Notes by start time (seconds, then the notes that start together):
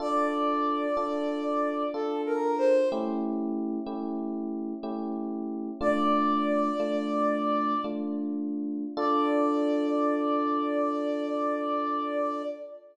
0.00 D4 F4 A4 D5
0.97 D4 F4 A4
1.94 D4 F4 A4
2.26 A#4
2.58 C5
2.92 A3 C#4 E4 G4
3.86 A3 C#4 E4 G4
4.83 A3 C#4 E4 G4
5.81 A3 D4 F4 D5
6.80 A3 D4 F4
7.84 A3 D4 F4
8.97 D4 F4 A4 D5